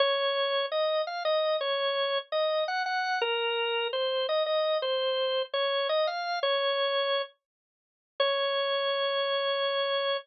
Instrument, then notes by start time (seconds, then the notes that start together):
drawbar organ
0.00 C#5
0.72 D#5
1.07 F5
1.25 D#5
1.61 C#5
2.32 D#5
2.68 F#5
2.86 F#5
3.22 A#4
3.93 C5
4.29 D#5
4.46 D#5
4.82 C5
5.53 C#5
5.89 D#5
6.07 F5
6.43 C#5
8.20 C#5